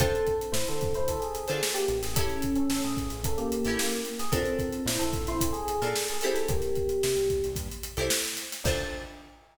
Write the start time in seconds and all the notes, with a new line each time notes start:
0.00 D2 C4 D4 F4 A4 C5, kick, closed hi-hat
0.15 closed hi-hat
0.27 kick, closed hi-hat
0.41 closed hi-hat
0.52 A2 E4 C5, snare
0.67 D3 C4 A4, snare, closed hi-hat
0.81 D3, kick, closed hi-hat
0.94 D2 E4 C5, closed hi-hat
1.08 D2 C4 A4, kick, closed hi-hat
1.20 G#4, closed hi-hat
1.35 closed hi-hat
1.48 D3 D4 F4 A4 C5, closed hi-hat
1.63 snare
1.74 A#3 G4, closed hi-hat
1.88 A1, closed hi-hat
2.03 G#4, snare, closed hi-hat
2.16 C#4 E4 G4 A4, kick, closed hi-hat
2.30 closed hi-hat
2.42 kick, closed hi-hat
2.56 C#4 A4, closed hi-hat
2.69 A1 C#4 A4, snare
2.82 A2 G#4, closed hi-hat
2.97 A1, kick, closed hi-hat
3.10 A1, closed hi-hat
3.23 A1 C#4 A4, kick, closed hi-hat
3.37 A#3 G4, closed hi-hat
3.52 closed hi-hat
3.65 A1 C#4 E4 G4 A4, closed hi-hat
3.79 A#3 G4, snare
3.91 closed hi-hat
4.05 closed hi-hat
4.19 G#4, snare, closed hi-hat
4.32 A#1 C4 D4 F4 A4 A#4, kick, closed hi-hat
4.45 closed hi-hat
4.59 kick, closed hi-hat
4.73 closed hi-hat
4.86 A#2 E4 C5, snare
4.99 A#1 C4 A4, closed hi-hat
5.13 A#1, kick, closed hi-hat
5.27 A#1 E4 C5, snare, closed hi-hat
5.41 A#1 C4 A4, kick, closed hi-hat
5.53 G#4, closed hi-hat
5.68 closed hi-hat
5.82 A#2 D4 F4 A4 A#4, closed hi-hat
5.95 snare
6.08 G#4, closed hi-hat
6.21 C4 E4 G4 A4, closed hi-hat
6.34 C4 A4, snare, closed hi-hat
6.49 C2 A#3 G4, kick, closed hi-hat
6.62 snare, closed hi-hat
6.75 kick, closed hi-hat
6.89 closed hi-hat
7.03 C3, snare
7.16 C2, closed hi-hat
7.29 C2, kick, closed hi-hat
7.44 C2, closed hi-hat
7.56 G2, kick, closed hi-hat
7.72 closed hi-hat
7.83 closed hi-hat
7.97 C2 C4 E4 G4 A4, closed hi-hat
8.10 snare
8.25 closed hi-hat
8.37 snare, closed hi-hat
8.52 snare, closed hi-hat
8.64 D2 D4 F4 A4 C5, kick, crash